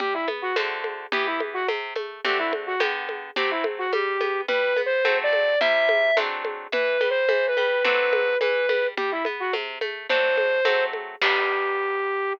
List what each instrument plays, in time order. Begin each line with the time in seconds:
0.00 orchestral harp G3, flute G4, low conga
0.14 flute E4
0.28 orchestral harp B3, high conga
0.42 flute F#4
0.56 orchestral harp D3 A3 C4 F#4, high conga
0.84 high conga
1.12 orchestral harp E3 B3 G4, flute G4, low conga
1.26 flute E4
1.40 high conga
1.54 flute F#4
1.68 orchestral harp C3, high conga
1.95 orchestral harp A3, high conga
2.24 orchestral harp D3 A3 C4 F#4, flute G4, low conga
2.38 flute E4
2.53 high conga
2.67 flute F#4
2.80 orchestral harp D3 B3 G4, high conga
3.09 high conga
3.36 orchestral harp F#3 A3 C4, flute G4, low conga
3.51 flute E4
3.64 high conga
3.78 flute F#4
3.93 orchestral harp G3, flute G4, high conga
4.21 orchestral harp B3, high conga
4.48 orchestral harp G3, flute B4, low conga
4.77 orchestral harp B3, high conga
4.86 flute C5
5.05 orchestral harp F#3 A3 C4, high conga
5.23 flute D5
5.33 high conga
5.61 orchestral harp C3 G3 E4, flute E5, low conga
5.89 high conga
6.17 orchestral harp F#3 A3 C4 D4, high conga
6.45 high conga
6.72 orchestral harp E3, flute B4, low conga
7.01 orchestral harp G3, high conga
7.10 flute C5
7.29 orchestral harp E3, high conga
7.48 flute B4
7.57 orchestral harp G3, high conga
7.84 orchestral harp F#3 A3 C4 D4, flute B4, low conga
8.13 high conga
8.41 orchestral harp E3, flute B4, high conga
8.69 orchestral harp G3, high conga
8.97 orchestral harp G3, flute G4, low conga
9.11 flute E4
9.25 orchestral harp B3, high conga
9.40 flute F#4
9.53 orchestral harp C3, high conga
9.81 orchestral harp A3, high conga
10.09 orchestral harp F#3 A3 C4 D4, flute C5, low conga
10.38 high conga
10.65 orchestral harp F#3 A3 C4, high conga
10.93 high conga
11.21 orchestral harp G3 B3 D4, flute G4, kick, crash